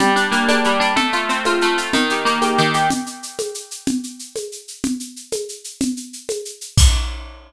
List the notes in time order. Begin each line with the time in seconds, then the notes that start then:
0.00 G3, low conga, shaker
0.16 D4, shaker
0.32 A#3, shaker
0.48 D4, high conga, shaker
0.64 G3, shaker
0.80 D4, shaker
0.96 A3, low conga, shaker
1.13 F4, shaker
1.29 C4, shaker
1.45 F4, high conga, shaker
1.61 A3, shaker
1.78 F4, shaker
1.93 D#3, low conga, shaker
2.10 G4, shaker
2.25 A#3, shaker
2.42 G4, high conga, shaker
2.58 D#3, shaker
2.74 G4, shaker
2.90 low conga, shaker
3.06 shaker
3.23 shaker
3.39 high conga, shaker
3.54 shaker
3.71 shaker
3.87 low conga, shaker
4.03 shaker
4.19 shaker
4.36 high conga, shaker
4.52 shaker
4.68 shaker
4.84 low conga, shaker
5.00 shaker
5.16 shaker
5.32 high conga, shaker
5.49 shaker
5.64 shaker
5.81 low conga, shaker
5.97 shaker
6.13 shaker
6.29 high conga, shaker
6.45 shaker
6.61 shaker
6.77 kick, crash